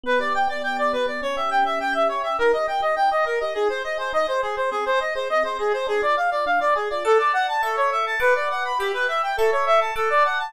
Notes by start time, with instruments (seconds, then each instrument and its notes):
0.03 electric piano 1 B3, clarinet B4
0.19 electric piano 1 G4, clarinet D5
0.34 electric piano 1 D5, clarinet G5
0.48 electric piano 1 B3, clarinet D5
0.61 electric piano 1 G4, clarinet G5
0.77 electric piano 1 D5, clarinet D5
0.93 electric piano 1 B3, clarinet B4
1.06 electric piano 1 G4, clarinet D5
1.22 electric piano 1 C#4, clarinet C#5
1.36 electric piano 1 G4, clarinet E5
1.49 electric piano 1 E5, clarinet G5
1.65 electric piano 1 C#4, clarinet E5
1.80 electric piano 1 G4, clarinet G5
1.93 electric piano 1 E5, clarinet E5
2.09 electric piano 1 C#4, clarinet C#5
2.23 electric piano 1 G4, clarinet E5
2.38 electric piano 1 D#4, clarinet A#4
2.53 electric piano 1 G4, clarinet D#5
2.67 electric piano 1 A#4, clarinet G5
2.80 electric piano 1 G4, clarinet D#5
2.96 electric piano 1 D#4, clarinet G5
3.11 electric piano 1 G4, clarinet D#5
3.25 electric piano 1 A#4, clarinet A#4
3.40 electric piano 1 G4, clarinet D#5
3.54 electric piano 1 D#4, clarinet G#4
3.69 electric piano 1 G#4, clarinet C5
3.84 electric piano 1 C5, clarinet D#5
3.98 electric piano 1 G#4, clarinet C5
4.13 electric piano 1 D#4, clarinet D#5
4.27 electric piano 1 G#4, clarinet C5
4.42 clarinet G#4, electric piano 1 C5
4.56 electric piano 1 G#4, clarinet C5
4.71 electric piano 1 C4, clarinet G#4
4.86 electric piano 1 G#4, clarinet C5
5.00 electric piano 1 D#5, clarinet D#5
5.15 electric piano 1 G#4, clarinet C5
5.30 electric piano 1 C4, clarinet D#5
5.43 electric piano 1 G#4, clarinet C5
5.59 clarinet G#4, electric piano 1 D#5
5.72 electric piano 1 G#4, clarinet C5
5.87 electric piano 1 D4, clarinet G#4
6.02 electric piano 1 F4, clarinet D5
6.15 electric piano 1 G#4, clarinet F5
6.31 electric piano 1 F4, clarinet D5
6.46 electric piano 1 D4, clarinet F5
6.60 electric piano 1 F4, clarinet D5
6.75 clarinet G#4, electric piano 1 G#4
6.90 electric piano 1 F4, clarinet D5
7.04 clarinet A4, electric piano 1 D5 F#5 A5
7.19 clarinet D5
7.33 clarinet F#5
7.48 clarinet A5
7.63 electric piano 1 A4 E5 C#6, clarinet A4
7.77 clarinet C#5
7.92 clarinet E5
8.06 clarinet A5
8.20 electric piano 1 B4 F#5 D6, clarinet B4
8.35 clarinet D5
8.50 clarinet F#5
8.65 clarinet B5
8.79 clarinet G4, electric piano 1 E5 G5 B5
8.94 clarinet B4
9.08 clarinet E5
9.23 clarinet G5
9.37 clarinet A4, electric piano 1 A4 E5 C#6
9.52 clarinet C#5
9.66 clarinet E5
9.81 clarinet A5
9.96 clarinet A4, electric piano 1 F#5 A5 D6
10.10 clarinet D5
10.25 clarinet F#5
10.39 clarinet A5